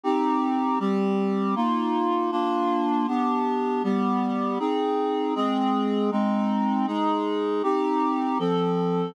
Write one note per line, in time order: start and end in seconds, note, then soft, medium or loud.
0.03 0.79 C4 medium
0.03 0.79 D#4 medium
0.03 0.79 G4 medium
0.79 1.55 G3 medium
0.79 1.55 C4 medium
0.79 1.55 G4 medium
1.55 2.31 A#3 medium
1.55 2.31 D#4 medium
1.55 2.31 F4 medium
2.31 3.06 A#3 medium
2.31 3.06 D4 medium
2.31 3.06 F4 medium
3.07 3.82 B3 medium
3.07 3.82 D4 medium
3.07 3.82 G4 medium
3.83 4.58 G3 medium
3.83 4.58 B3 medium
3.83 4.58 G4 medium
4.59 5.34 C4 medium
4.59 5.34 D#4 medium
4.59 5.34 G#4 medium
5.35 6.10 G#3 medium
5.35 6.10 C4 medium
5.35 6.10 G#4 medium
6.11 6.86 G#3 medium
6.11 6.86 C4 medium
6.11 6.86 D#4 medium
6.87 7.62 G#3 medium
6.87 7.62 D#4 medium
6.87 7.62 G#4 medium
7.63 8.38 C4 medium
7.63 8.38 D#4 medium
7.63 8.38 G4 medium
8.39 9.14 F3 medium
8.39 9.14 C4 medium
8.39 9.14 A4 medium